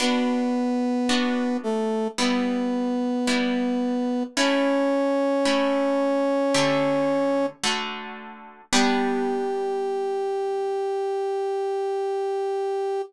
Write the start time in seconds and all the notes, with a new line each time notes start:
0.00 B3 D4 F#4 B4
1.09 B3 D4 F#4
1.63 A3 A4
2.18 G3 B3 E4 B4
3.27 G3 B3 E4
4.37 A3 C#4 E4 C#5
5.45 A3 C#4 E4
6.54 D3 A3 G4
7.64 D3 A3 F#4
8.72 G3 B3 D4 G4